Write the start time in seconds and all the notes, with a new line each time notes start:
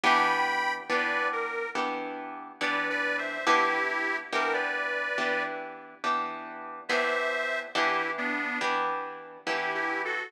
0.03 E3 B3 D4 G4 G5 B5
0.89 E3 B3 D4 G4 B4 D5
1.33 A#4
1.75 E3 B3 D4 G4
2.61 E3 B3 D4 G4 B4 D5
2.90 B4 D5
3.18 C5 E5
3.46 E3 B3 D4 E4 G4
4.33 E3 B3 D4 G4 A#4
4.53 B4 D5
5.18 E3 B3 D4 G4
6.04 E3 B3 D4 G4
6.89 E3 B3 D4 G4 C5 E5
7.75 E3 B3 D4 E4 G4
8.18 B3 D4
8.61 E3 B3 D4 G4
9.46 E3 B3 D4 E4 G4
9.74 E4 G4
10.05 F#4 A4